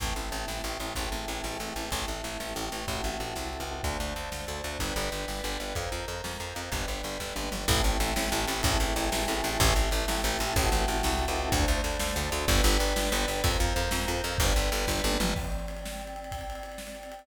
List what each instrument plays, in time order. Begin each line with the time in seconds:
0.00 electric bass (finger) A1, choir aahs C4 E4 A4, kick, ride
0.16 electric bass (finger) A1, ride
0.31 electric bass (finger) A1, ride
0.48 electric bass (finger) A1, snare
0.64 electric bass (finger) A1, ride
0.80 electric bass (finger) A1, ride
0.95 electric bass (finger) A1, choir aahs C4 E4 G#4 A4, kick, ride
1.12 electric bass (finger) A1, ride
1.28 electric bass (finger) A1, ride
1.44 electric bass (finger) A1, snare
1.60 electric bass (finger) A1, ride
1.76 electric bass (finger) A1, ride
1.91 electric bass (finger) A1, choir aahs C4 E4 G4 A4, kick, ride
2.06 electric bass (finger) A1, ride
2.24 electric bass (finger) A1, ride
2.40 electric bass (finger) A1, snare
2.55 electric bass (finger) A1, ride
2.72 electric bass (finger) A1, ride
2.87 electric bass (finger) A1, choir aahs C4 E4 F#4 A4, kick, ride
3.04 electric bass (finger) A1, ride
3.19 electric bass (finger) A1, ride
3.36 electric bass (finger) C2, snare
3.53 ride
3.60 electric bass (finger) C#2
3.67 ride
3.83 electric bass (finger) D2, choir aahs C5 D5 F5 A5, kick, ride
4.00 electric bass (finger) D2, ride
4.16 electric bass (finger) D2, ride
4.32 electric bass (finger) D2, snare
4.47 electric bass (finger) D2, ride
4.64 electric bass (finger) D2, ride
4.79 electric bass (finger) G1, choir aahs B4 D5 G5, kick, ride
4.96 electric bass (finger) G1, ride
5.11 electric bass (finger) G1, ride
5.28 electric bass (finger) G1, snare
5.43 electric bass (finger) G1, ride
5.60 electric bass (finger) G1, ride
5.75 electric bass (finger) F2, choir aahs A#4 C5 F5, kick, ride
5.92 electric bass (finger) F2, ride
6.08 electric bass (finger) F2, ride
6.24 electric bass (finger) F2, snare
6.40 electric bass (finger) F2, ride
6.55 electric bass (finger) F2, ride
6.72 electric bass (finger) G1, choir aahs B4 D5 G5, kick, ride
6.88 electric bass (finger) G1, ride
7.03 electric bass (finger) G1, ride
7.20 electric bass (finger) G1, kick, snare
7.35 electric bass (finger) G1, high tom
7.51 electric bass (finger) G1, mid tom
7.68 electric bass (finger) A1, choir aahs C4 E4 A4, kick, ride
7.84 electric bass (finger) A1, ride
8.00 electric bass (finger) A1, ride
8.16 electric bass (finger) A1, snare
8.32 electric bass (finger) A1, ride
8.48 electric bass (finger) A1, ride
8.63 electric bass (finger) A1, choir aahs C4 E4 G#4 A4, kick, ride
8.80 electric bass (finger) A1, ride
8.96 electric bass (finger) A1, ride
9.12 electric bass (finger) A1, snare
9.28 electric bass (finger) A1, ride
9.44 electric bass (finger) A1, ride
9.60 electric bass (finger) A1, choir aahs C4 E4 G4 A4, kick, ride
9.76 electric bass (finger) A1, ride
9.91 electric bass (finger) A1, ride
10.08 electric bass (finger) A1, snare
10.22 electric bass (finger) A1, ride
10.39 electric bass (finger) A1, ride
10.56 electric bass (finger) A1, choir aahs C4 E4 F#4 A4, kick, ride
10.72 electric bass (finger) A1, ride
10.88 electric bass (finger) A1, ride
11.03 electric bass (finger) C2, snare
11.19 ride
11.28 electric bass (finger) C#2
11.36 ride
11.52 electric bass (finger) D2, choir aahs C5 D5 F5 A5, kick, ride
11.68 electric bass (finger) D2, ride
11.84 electric bass (finger) D2, ride
11.99 electric bass (finger) D2, snare
12.16 electric bass (finger) D2, ride
12.32 electric bass (finger) D2, ride
12.48 electric bass (finger) G1, choir aahs B4 D5 G5, kick, ride
12.63 electric bass (finger) G1, ride
12.79 electric bass (finger) G1, ride
12.96 electric bass (finger) G1, snare
13.12 electric bass (finger) G1, ride
13.28 electric bass (finger) G1, ride
13.43 electric bass (finger) F2, choir aahs A#4 C5 F5, kick, ride
13.60 electric bass (finger) F2, ride
13.76 electric bass (finger) F2, ride
13.91 electric bass (finger) F2, snare
14.08 electric bass (finger) F2, ride
14.24 electric bass (finger) F2, ride
14.38 electric bass (finger) G1, choir aahs B4 D5 G5, kick, ride
14.55 electric bass (finger) G1, ride
14.72 electric bass (finger) G1, ride
14.87 electric bass (finger) G1, kick, snare
15.04 electric bass (finger) G1, high tom
15.20 electric bass (finger) G1, mid tom
15.36 choir aahs C4 D5 G5, kick, crash
15.44 ride
15.52 ride
15.60 ride
15.68 ride
15.77 ride
15.85 snare
15.90 ride
16.00 ride
16.07 ride
16.16 ride
16.24 ride
16.32 kick, ride
16.41 ride
16.50 ride
16.55 ride
16.63 ride
16.72 ride
16.78 snare
16.87 ride
16.95 ride
17.03 ride
17.12 ride
17.19 ride